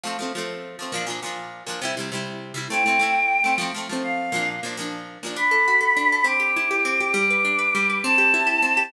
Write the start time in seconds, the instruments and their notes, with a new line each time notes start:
0.04 pizzicato strings F3 A3 C4
0.19 pizzicato strings F3 A3 C4
0.35 pizzicato strings F3 A3 C4
0.79 pizzicato strings F3 A3 C4
0.92 pizzicato strings A#2 F3 D4
1.06 pizzicato strings A#2 F3 D4
1.23 pizzicato strings A#2 F3 D4
1.67 pizzicato strings A#2 F3 D4
1.82 pizzicato strings C3 G3 E4
1.97 pizzicato strings C3 G3 E4
2.12 pizzicato strings C3 G3 E4
2.54 pizzicato strings C3 G3 E4
2.70 pizzicato strings A3 C4 E4, choir aahs G5
2.86 pizzicato strings A3 C4 E4
2.99 pizzicato strings A3 C4 E4
3.44 pizzicato strings A3 C4 E4
3.58 pizzicato strings F3 A3 C4
3.75 pizzicato strings F3 A3 C4
3.89 pizzicato strings F3 A3 C4
4.04 choir aahs F5
4.32 pizzicato strings A#2 F3 D4
4.63 pizzicato strings A#2 F3 D4
4.77 pizzicato strings A#2 F3 D4
5.23 pizzicato strings A#2 F3 D4
5.36 pizzicato strings D4, choir aahs B5
5.51 pizzicato strings A4
5.68 pizzicato strings F#4
5.81 pizzicato strings A4
5.97 pizzicato strings D4
6.12 pizzicato strings A4
6.24 pizzicato strings C4, choir aahs D6
6.40 pizzicato strings G4
6.56 pizzicato strings E4
6.71 pizzicato strings G4
6.85 pizzicato strings C4
7.00 pizzicato strings G4
7.14 pizzicato strings G3, choir aahs D6
7.30 pizzicato strings B4
7.45 pizzicato strings D4
7.59 pizzicato strings B4
7.75 pizzicato strings G3
7.90 pizzicato strings B4
8.04 pizzicato strings C4, choir aahs A5
8.18 pizzicato strings G4
8.34 pizzicato strings E4
8.47 pizzicato strings G4
8.62 pizzicato strings C4
8.77 pizzicato strings G4